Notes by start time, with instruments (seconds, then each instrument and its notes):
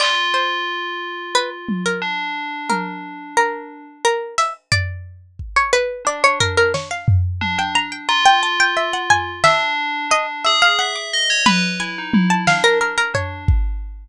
0.00 tubular bells F4, harpsichord D5, clap
0.34 harpsichord C5
1.35 harpsichord B4
1.69 high tom
1.86 harpsichord A#4
2.02 tubular bells D4
2.70 harpsichord A#4, high tom
3.37 harpsichord A#4
4.05 harpsichord A#4
4.38 harpsichord E5, closed hi-hat
4.72 harpsichord D5, floor tom
5.39 kick
5.56 harpsichord C#5
5.73 harpsichord B4
6.05 tubular bells D4, harpsichord D5
6.24 harpsichord C#5
6.40 harpsichord A#4, floor tom
6.57 harpsichord A#4
6.74 harpsichord C#5, snare
6.91 harpsichord F5
7.08 floor tom
7.41 tubular bells D4, high tom
7.58 tubular bells D4, harpsichord G5
7.75 tubular bells D4, harpsichord A#5
7.92 harpsichord G5
8.09 tubular bells F4, harpsichord A#5
8.25 harpsichord G5
8.43 harpsichord A5
8.60 harpsichord G5
8.77 harpsichord E5
8.93 harpsichord F#5
9.10 harpsichord G#5, floor tom
9.44 tubular bells D4, harpsichord E5, snare
10.11 tubular bells D4, harpsichord D#5
10.45 tubular bells G#4, harpsichord E5
10.62 harpsichord F5
10.79 tubular bells E5, harpsichord F#5
10.96 harpsichord D6
11.13 tubular bells D#5
11.30 tubular bells C#5
11.46 tubular bells B4, harpsichord B5, high tom
11.80 tubular bells E4, harpsichord G#5
11.98 tubular bells D#4
12.13 tubular bells E4, high tom
12.30 harpsichord A5
12.47 tubular bells D4, harpsichord F5, snare
12.64 harpsichord A#4
12.81 harpsichord A#4
12.98 harpsichord A#4
13.14 tubular bells D4, harpsichord C#5, floor tom
13.48 kick